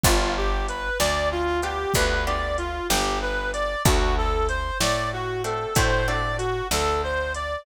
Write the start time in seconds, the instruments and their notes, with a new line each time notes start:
0.03 electric bass (finger) G1, acoustic guitar (steel) B3 D4 F4 G4, clarinet F4, kick, closed hi-hat
0.37 clarinet G4
0.69 clarinet B4, closed hi-hat
0.99 electric bass (finger) D2, clarinet D5, snare
1.32 clarinet F4
1.62 acoustic guitar (steel) B3 D4 F4 G4, clarinet G4, closed hi-hat
1.94 electric bass (finger) D2, acoustic guitar (steel) B3 D4 F4 G4, clarinet B4, kick, closed hi-hat
2.27 acoustic guitar (steel) B3 D4 F4 G4, clarinet D5
2.58 clarinet F4, closed hi-hat
2.89 electric bass (finger) G1, clarinet G4, snare
3.22 clarinet B4
3.53 clarinet D5, closed hi-hat
3.85 electric bass (finger) D2, acoustic guitar (steel) A3 C4 D4 F#4, clarinet F#4, kick, closed hi-hat
4.18 clarinet A4
4.49 clarinet C5, closed hi-hat
4.80 electric bass (finger) A2, clarinet D5, snare
5.13 clarinet F#4
5.44 acoustic guitar (steel) A3 C4 D4 F#4, clarinet A4, closed hi-hat
5.75 electric bass (finger) A2, acoustic guitar (steel) A3 C4 D4 F#4, clarinet C5, kick, closed hi-hat
6.07 acoustic guitar (steel) A3 C4 D4 F#4, clarinet D5
6.38 clarinet F#4, closed hi-hat
6.71 electric bass (finger) D2, clarinet A4, snare
7.04 clarinet C5
7.35 clarinet D5, closed hi-hat